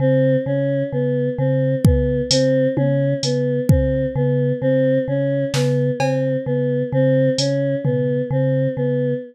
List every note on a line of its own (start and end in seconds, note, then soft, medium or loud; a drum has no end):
0.00 0.37 C#3 medium
0.00 0.36 C4 medium
0.46 0.83 C#3 medium
0.46 0.83 C#4 medium
0.92 1.29 C#3 medium
0.92 1.29 B3 medium
1.38 1.75 C#3 medium
1.38 1.75 C4 medium
1.85 2.21 C#3 medium
1.85 2.22 B3 medium
1.85 kick loud
2.31 2.68 C#3 medium
2.31 2.68 C4 medium
2.31 closed hi-hat loud
2.77 3.14 C#3 medium
2.77 3.14 C#4 medium
2.77 high tom medium
3.23 3.60 C#3 medium
3.23 3.61 B3 medium
3.23 closed hi-hat medium
3.69 4.06 C#3 medium
3.69 4.06 C4 medium
3.69 kick medium
4.16 4.53 C#3 medium
4.16 4.53 B3 medium
4.62 4.99 C#3 medium
4.62 4.98 C4 medium
5.08 5.45 C#3 medium
5.08 5.45 C#4 medium
5.54 5.91 C#3 medium
5.54 5.91 B3 medium
5.54 snare medium
6.00 6.37 C#3 medium
6.00 6.37 C4 medium
6.00 cowbell medium
6.46 6.83 C#3 medium
6.46 6.83 B3 medium
6.93 7.29 C#3 medium
6.93 7.30 C4 medium
7.38 7.75 C#3 medium
7.38 7.75 C#4 medium
7.38 closed hi-hat medium
7.84 8.22 C#3 medium
7.84 8.21 B3 medium
7.84 floor tom medium
8.31 8.68 C#3 medium
8.31 8.69 C4 medium
8.77 9.14 C#3 medium
8.77 9.13 B3 medium